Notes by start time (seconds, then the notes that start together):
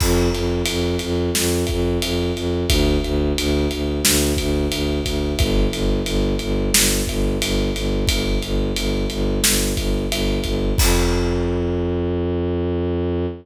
0.00 F2, kick, crash
0.33 F2, ride
0.66 F2, ride
0.99 F2, ride
1.35 F2, snare
1.67 F2, kick, ride
2.02 F2, ride
2.36 F2, ride
2.69 D2, kick, ride
3.04 D2, ride
3.38 D2, ride
3.71 D2, ride
4.04 D2, snare
4.37 D2, kick, ride
4.71 D2, ride
5.05 D2, kick, ride
5.38 G1, kick, ride
5.72 G1, ride
6.06 G1, ride
6.39 G1, ride
6.73 G1, snare
7.07 G1, kick, ride
7.42 G1, ride
7.76 G1, ride
8.07 G1, kick, ride
8.43 G1, ride
8.76 G1, ride
9.10 G1, ride
9.44 G1, snare
9.77 G1, kick, ride
10.11 G1, ride
10.44 G1, kick, ride
10.78 F2, kick, crash